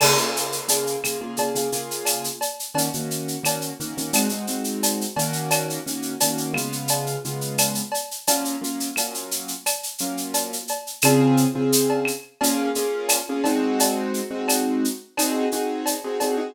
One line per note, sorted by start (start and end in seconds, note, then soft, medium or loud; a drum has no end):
0.00 0.14 C#3 medium
0.00 0.14 A#3 medium
0.00 0.14 F4 medium
0.00 0.14 G#4 medium
0.00 crash loud
0.00 cowbell medium
0.00 claves loud
0.17 0.59 C#3 medium
0.17 0.59 A#3 medium
0.17 0.59 F4 medium
0.17 0.59 G#4 medium
0.17 shaker medium
0.36 shaker medium
0.52 shaker medium
0.68 0.96 C#3 medium
0.68 0.96 A#3 medium
0.68 0.96 F4 medium
0.68 0.96 G#4 medium
0.68 cowbell medium
0.68 shaker loud
0.87 shaker medium
1.04 1.18 C#3 medium
1.04 1.18 A#3 medium
1.04 1.18 F4 medium
1.04 1.18 G#4 medium
1.04 claves medium
1.04 shaker medium
1.21 1.35 C#3 medium
1.21 1.35 A#3 medium
1.21 1.35 F4 medium
1.21 1.35 G#4 medium
1.37 1.51 C#3 medium
1.37 1.51 A#3 medium
1.37 1.51 F4 medium
1.37 1.51 G#4 medium
1.37 cowbell medium
1.37 shaker medium
1.55 1.69 C#3 medium
1.55 1.69 A#3 medium
1.55 1.69 F4 medium
1.55 1.69 G#4 medium
1.55 shaker medium
1.72 2.28 C#3 medium
1.72 2.28 A#3 medium
1.72 2.28 F4 medium
1.72 2.28 G#4 medium
1.72 shaker medium
1.91 shaker medium
2.05 cowbell medium
2.05 claves medium
2.05 shaker medium
2.24 shaker medium
2.41 cowbell medium
2.41 shaker medium
2.59 shaker medium
2.74 2.88 D#3 medium
2.74 2.88 A#3 medium
2.74 2.88 C#4 medium
2.74 2.88 F#4 medium
2.74 cowbell medium
2.74 shaker medium
2.93 3.36 D#3 medium
2.93 3.36 A#3 medium
2.93 3.36 C#4 medium
2.93 3.36 F#4 medium
2.93 shaker medium
3.11 shaker medium
3.28 shaker medium
3.43 3.71 D#3 medium
3.43 3.71 A#3 medium
3.43 3.71 C#4 medium
3.43 3.71 F#4 medium
3.43 cowbell medium
3.43 claves medium
3.43 shaker medium
3.61 shaker medium
3.80 3.94 D#3 medium
3.80 3.94 A#3 medium
3.80 3.94 C#4 medium
3.80 3.94 F#4 medium
3.80 shaker medium
3.97 4.11 D#3 medium
3.97 4.11 A#3 medium
3.97 4.11 C#4 medium
3.97 4.11 F#4 medium
3.97 shaker medium
4.13 4.27 G#3 medium
4.13 4.27 C4 medium
4.13 4.27 D#4 medium
4.13 4.27 F#4 medium
4.13 cowbell medium
4.13 claves medium
4.13 shaker loud
4.29 4.45 G#3 medium
4.29 4.45 C4 medium
4.29 4.45 D#4 medium
4.29 4.45 F#4 medium
4.29 shaker medium
4.47 5.04 G#3 medium
4.47 5.04 C4 medium
4.47 5.04 D#4 medium
4.47 5.04 F#4 medium
4.47 shaker medium
4.64 shaker medium
4.83 cowbell medium
4.83 shaker medium
5.01 shaker medium
5.16 5.79 D#3 medium
5.16 5.79 A#3 medium
5.16 5.79 C#4 medium
5.16 5.79 F#4 medium
5.16 cowbell medium
5.16 shaker medium
5.33 shaker medium
5.51 cowbell medium
5.51 claves medium
5.51 shaker medium
5.70 shaker medium
5.86 6.14 D#3 medium
5.86 6.14 A#3 medium
5.86 6.14 C#4 medium
5.86 6.14 F#4 medium
5.86 shaker medium
6.02 shaker medium
6.20 6.54 D#3 medium
6.20 6.54 A#3 medium
6.20 6.54 C#4 medium
6.20 6.54 F#4 medium
6.20 cowbell medium
6.20 shaker loud
6.38 shaker medium
6.54 7.16 C#3 medium
6.54 7.16 G#3 medium
6.54 7.16 B3 medium
6.54 7.16 F4 medium
6.54 claves medium
6.54 shaker medium
6.72 shaker medium
6.88 cowbell medium
6.88 shaker medium
7.06 shaker medium
7.25 7.80 C#3 medium
7.25 7.80 G#3 medium
7.25 7.80 B3 medium
7.25 7.80 F4 medium
7.25 shaker medium
7.41 shaker medium
7.58 cowbell medium
7.58 claves medium
7.58 shaker loud
7.75 shaker medium
7.92 cowbell medium
7.92 shaker medium
8.11 shaker medium
8.27 8.55 F#3 medium
8.27 8.55 A#3 medium
8.27 8.55 C#4 medium
8.27 8.55 F4 medium
8.27 cowbell medium
8.27 shaker loud
8.45 shaker medium
8.61 8.89 F#3 medium
8.61 8.89 A#3 medium
8.61 8.89 C#4 medium
8.61 8.89 F4 medium
8.61 shaker medium
8.80 shaker medium
8.96 9.52 F#3 medium
8.96 9.52 A#3 medium
8.96 9.52 C#4 medium
8.96 9.52 F4 medium
8.96 cowbell medium
8.96 claves medium
8.96 shaker medium
9.14 shaker medium
9.31 shaker medium
9.48 shaker medium
9.66 cowbell medium
9.66 claves medium
9.66 shaker medium
9.83 shaker medium
9.98 10.56 F#3 medium
9.98 10.56 A#3 medium
9.98 10.56 C#4 medium
9.98 10.56 F4 medium
9.98 shaker medium
10.17 shaker medium
10.34 cowbell medium
10.34 shaker medium
10.53 shaker medium
10.68 cowbell medium
10.68 shaker medium
10.87 shaker medium
11.02 11.45 C#3 loud
11.02 11.45 C4 loud
11.02 11.45 F4 medium
11.02 11.45 G#4 loud
11.02 cowbell medium
11.02 claves loud
11.02 shaker loud
11.37 shaker medium
11.55 12.10 C#3 medium
11.55 12.10 C4 medium
11.55 12.10 F4 medium
11.55 12.10 G#4 medium
11.72 shaker loud
11.90 cowbell medium
12.05 claves medium
12.05 shaker medium
12.41 12.69 A#3 loud
12.41 12.69 C#4 loud
12.41 12.69 F4 loud
12.41 12.69 G#4 loud
12.41 cowbell medium
12.41 shaker medium
12.75 13.18 A#3 medium
12.75 13.18 C#4 loud
12.75 13.18 F4 medium
12.75 13.18 G#4 medium
12.75 shaker medium
13.09 cowbell medium
13.09 claves medium
13.09 shaker loud
13.29 13.43 A#3 medium
13.29 13.43 C#4 medium
13.29 13.43 F4 medium
13.29 13.43 G#4 medium
13.44 14.20 G#3 loud
13.44 14.20 C4 loud
13.44 14.20 D#4 medium
13.44 14.20 F#4 loud
13.44 cowbell medium
13.44 shaker medium
13.80 cowbell medium
13.80 shaker medium
14.14 shaker medium
14.31 14.86 G#3 medium
14.31 14.86 C4 medium
14.31 14.86 D#4 medium
14.31 14.86 F#4 medium
14.48 cowbell medium
14.48 claves medium
14.48 shaker medium
14.84 shaker medium
15.17 15.46 C4 loud
15.17 15.46 D#4 loud
15.17 15.46 F#4 medium
15.17 15.46 G#4 loud
15.17 cowbell medium
15.17 claves medium
15.17 shaker medium
15.52 15.94 C4 medium
15.52 15.94 D#4 medium
15.52 15.94 F#4 medium
15.52 15.94 G#4 medium
15.52 shaker medium
15.86 cowbell medium
15.86 shaker medium
16.04 16.18 C4 medium
16.04 16.18 D#4 medium
16.04 16.18 F#4 medium
16.04 16.18 G#4 medium
16.20 16.35 C4 medium
16.20 16.35 D#4 medium
16.20 16.35 F#4 medium
16.20 16.35 G#4 medium
16.20 cowbell medium
16.20 shaker medium
16.37 16.51 C4 medium
16.37 16.51 D#4 medium
16.37 16.51 F#4 medium
16.37 16.51 G#4 medium